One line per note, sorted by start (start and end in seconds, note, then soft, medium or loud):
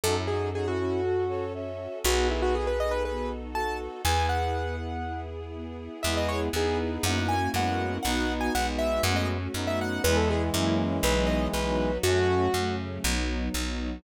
0.04 1.88 F#2 medium
0.04 2.02 C#4 medium
0.04 0.26 C#4 medium
0.04 0.16 D#4 medium
0.04 2.02 F#4 medium
0.04 0.16 F#4 medium
0.04 2.02 A4 medium
0.04 0.16 A4 medium
0.16 0.28 C#4 medium
0.16 0.28 E4 medium
0.28 0.51 D#4 medium
0.28 0.51 F#4 medium
0.28 0.49 G#4 medium
0.54 0.66 D#4 medium
0.54 0.66 F#4 medium
0.54 0.67 G#4 medium
0.54 0.77 A4 medium
0.66 0.78 C#4 medium
0.66 0.78 E4 medium
0.66 1.45 F#4 medium
0.78 1.00 C#4 medium
0.78 1.01 C#4 medium
0.78 1.01 E4 medium
1.04 1.24 F#4 medium
1.04 1.26 F#4 medium
1.04 1.24 A4 medium
1.29 1.53 A4 medium
1.29 1.52 A4 medium
1.29 1.53 C#5 medium
1.53 1.75 C#4 medium
1.53 1.99 C#5 medium
1.53 1.99 E5 medium
1.78 2.01 F#4 medium
2.04 3.88 B1 medium
2.04 2.26 B3 medium
2.04 4.02 B3 medium
2.04 4.02 D#4 medium
2.04 4.02 F#4 medium
2.04 2.28 F#4 medium
2.04 3.32 G#4 medium
2.04 4.02 A4 medium
2.04 3.32 B4 medium
2.29 2.51 D#4 medium
2.29 2.42 E4 medium
2.42 2.54 F#4 medium
2.54 2.77 F#4 medium
2.54 2.67 G#4 medium
2.67 2.79 B4 medium
2.79 3.02 A4 medium
2.79 2.92 D#5 medium
2.91 3.03 B4 medium
3.04 3.27 B3 medium
3.04 3.29 B4 medium
3.28 3.51 D#4 medium
3.54 4.02 F#4 medium
3.54 3.77 F#4 soft
3.54 4.02 A4 medium
3.54 3.77 A5 medium
3.79 4.02 A4 medium
4.04 5.89 E2 medium
4.04 6.02 B3 loud
4.04 4.27 B3 medium
4.04 6.02 E4 medium
4.04 6.02 G#4 loud
4.04 4.76 G#4 medium
4.04 4.76 B4 medium
4.04 4.26 G#5 medium
4.28 4.51 E4 medium
4.28 5.20 F#5 medium
4.55 4.77 G#4 medium
4.79 5.02 B3 medium
5.03 5.26 E4 medium
5.30 5.53 G#4 medium
5.55 5.77 B3 medium
5.80 6.03 E4 medium
6.03 6.49 E2 medium
6.03 6.49 G#3 medium
6.03 6.53 B3 medium
6.03 6.49 B3 medium
6.03 6.53 E4 loud
6.03 6.49 E4 medium
6.03 6.53 G#4 loud
6.03 6.49 G#4 medium
6.03 6.15 E5 medium
6.17 6.29 D#5 medium
6.29 6.40 C#5 medium
6.53 6.98 E2 medium
6.53 7.35 B3 medium
6.53 7.04 B3 medium
6.53 7.00 B3 medium
6.53 7.35 D#4 medium
6.53 7.00 E4 medium
6.53 7.04 G#4 loud
6.53 7.00 G#4 medium
6.53 6.78 G#4 medium
6.53 7.04 B4 loud
7.03 7.48 F#2 medium
7.03 7.49 A#3 medium
7.03 7.53 A#3 medium
7.03 7.49 C#4 medium
7.03 7.53 C#4 medium
7.03 7.49 E4 medium
7.03 7.53 E4 medium
7.03 7.49 F#4 medium
7.03 7.53 F#4 loud
7.03 7.27 F#5 medium
7.29 7.49 G#5 medium
7.53 7.99 F#2 medium
7.53 7.97 G#3 medium
7.53 7.98 A#3 medium
7.53 8.04 A#3 loud
7.53 7.97 B3 medium
7.53 7.98 C#4 medium
7.53 8.04 C#4 medium
7.53 7.98 E4 medium
7.53 7.98 F#4 medium
7.53 8.04 F#4 loud
7.53 8.04 A#4 medium
7.53 7.97 F#5 medium
8.03 8.50 B1 medium
8.03 8.48 B3 loud
8.03 8.54 B3 medium
8.03 8.53 B3 medium
8.03 8.48 D#4 medium
8.03 8.54 D#4 medium
8.03 8.53 D#4 medium
8.03 8.48 F#4 medium
8.03 8.54 F#4 loud
8.03 8.33 F#5 medium
8.41 8.53 G#5 medium
8.53 9.00 B1 medium
8.53 9.38 G#3 medium
8.53 8.98 B3 medium
8.53 9.04 B3 medium
8.53 9.38 B3 medium
8.53 8.98 D#4 medium
8.53 8.98 F#4 medium
8.53 9.04 F#4 loud
8.53 9.04 B4 medium
8.53 8.67 F#5 medium
8.79 9.02 E5 medium
9.03 9.48 F#2 medium
9.03 9.49 A3 medium
9.03 9.53 A3 loud
9.03 9.49 C#4 medium
9.03 9.54 C#4 loud
9.03 9.49 F#4 medium
9.03 9.53 F#4 medium
9.03 9.16 F#5 medium
9.16 9.28 D#5 medium
9.54 9.99 F#2 medium
9.54 10.03 F#3 medium
9.54 9.99 A3 medium
9.54 10.03 A3 medium
9.54 10.02 B3 medium
9.54 9.99 C#4 medium
9.54 10.02 D#4 medium
9.54 9.99 F#4 medium
9.54 10.03 F#4 medium
9.67 9.79 E5 medium
9.81 10.02 F#5 medium
10.04 10.50 E2 medium
10.04 11.91 E3 medium
10.04 10.54 G#3 loud
10.04 11.91 G#3 loud
10.04 10.49 G#3 medium
10.04 10.54 B3 loud
10.04 10.49 B3 medium
10.04 10.53 E4 loud
10.04 10.49 E4 medium
10.04 10.16 B4 medium
10.17 10.29 A4 medium
10.30 10.42 G#4 medium
10.53 11.00 F#2 medium
10.53 10.98 F#3 medium
10.53 11.03 F#3 loud
10.53 10.98 A#3 loud
10.53 11.03 A#3 medium
10.53 10.98 C#4 medium
10.53 11.03 C#4 medium
10.53 10.98 E4 medium
10.53 11.03 E4 medium
10.53 10.75 E4 medium
11.03 11.48 B1 medium
11.03 11.53 F#3 loud
11.03 11.49 F#3 medium
11.03 11.53 B3 medium
11.03 11.49 B3 loud
11.03 11.53 D#4 medium
11.03 11.49 D#4 medium
11.03 11.28 B4 medium
11.27 11.47 D#5 medium
11.53 11.99 B1 medium
11.53 11.99 F#3 medium
11.53 12.04 F#3 medium
11.53 11.99 B3 medium
11.53 11.99 D#4 medium
11.53 12.04 D#4 loud
11.53 12.04 F#4 loud
11.53 11.98 B4 medium
12.03 12.48 F#2 medium
12.03 12.48 F#3 medium
12.03 12.54 F#3 loud
12.03 12.48 A3 medium
12.03 12.47 A3 medium
12.03 12.54 A3 medium
12.03 12.48 C#4 medium
12.03 12.47 C#4 medium
12.03 12.54 C#4 medium
12.03 12.76 F#4 medium
12.54 12.99 F#2 medium
12.54 13.04 C#3 medium
12.54 13.04 F#3 medium
12.54 13.00 F#3 medium
12.54 13.00 A3 medium
12.54 13.04 C#4 loud
12.54 13.00 C#4 medium
13.04 13.49 B1 medium
13.04 13.49 F#3 medium
13.04 13.54 F#3 medium
13.04 13.49 B3 loud
13.04 13.54 B3 medium
13.04 13.49 D#4 medium
13.04 13.54 D#4 medium
13.53 13.99 B1 medium
13.53 13.98 F#3 medium
13.53 14.03 F#3 medium
13.53 13.98 B3 medium
13.53 13.98 D#4 medium
13.53 14.03 D#4 medium
13.53 14.03 F#4 medium